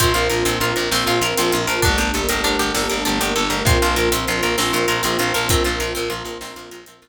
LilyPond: <<
  \new Staff \with { instrumentName = "Pizzicato Strings" } { \time 12/8 \key bes \major \tempo 4. = 131 c'8 f'8 bes'8 c'8 f'8 bes'8 c'8 f'8 bes'8 c'8 f'8 bes'8 | d'8 g'8 a'8 bes'8 d'8 g'8 a'8 bes'8 d'8 g'8 a'8 bes'8 | c'8 f'8 bes'8 c'8 f'8 bes'8 c'8 f'8 bes'8 c'8 f'8 bes'8 | c'8 f'8 bes'8 c'8 f'8 bes'8 c'8 f'8 bes'8 c'8 f'8 r8 | }
  \new Staff \with { instrumentName = "Electric Bass (finger)" } { \clef bass \time 12/8 \key bes \major bes,,8 bes,,8 bes,,8 bes,,8 bes,,8 bes,,8 bes,,8 bes,,8 bes,,8 bes,,8 bes,,8 bes,,8 | g,,8 g,,8 g,,8 g,,8 g,,8 g,,8 g,,8 g,,8 g,,8 g,,8 g,,8 g,,8 | bes,,8 bes,,8 bes,,8 bes,,8 bes,,8 bes,,8 bes,,8 bes,,8 bes,,8 bes,,8 bes,,8 bes,,8 | bes,,8 bes,,8 bes,,8 bes,,8 bes,,8 bes,,8 bes,,8 bes,,8 bes,,8 bes,,8 bes,,8 r8 | }
  \new Staff \with { instrumentName = "Choir Aahs" } { \time 12/8 \key bes \major <bes c' f'>1. | <a bes d' g'>1. | <bes c' f'>1. | <bes c' f'>1. | }
  \new DrumStaff \with { instrumentName = "Drums" } \drummode { \time 12/8 <hh bd>8 hh8 hh8 hh8 hh8 hh8 sn8 hh8 hh8 hh8 hh8 hh8 | <hh bd>8 hh8 hh8 hh8 hh8 hh8 sn8 hh8 hh8 hh8 hh8 hh8 | <hh bd>8 hh8 hh8 hh8 hh8 hh8 sn8 hh8 hh8 hh8 hh8 hh8 | <hh bd>8 hh8 hh8 hh8 hh8 hh8 sn8 hh8 hh8 hh8 hh4 | }
>>